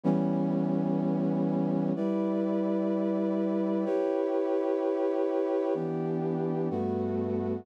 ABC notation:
X:1
M:4/4
L:1/8
Q:"Swing" 1/4=126
K:G
V:1 name="Brass Section"
[E,G,B,^C]8 | [G,EBd]8 | [EGB^c]8 | [K:Em] [E,B,DG]4 [G,,A,B,F]4 |]